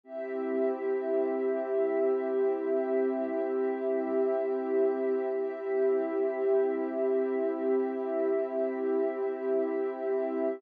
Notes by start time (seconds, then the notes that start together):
0.03 C4 E4 G4 E5
5.33 C4 E4 G4 E5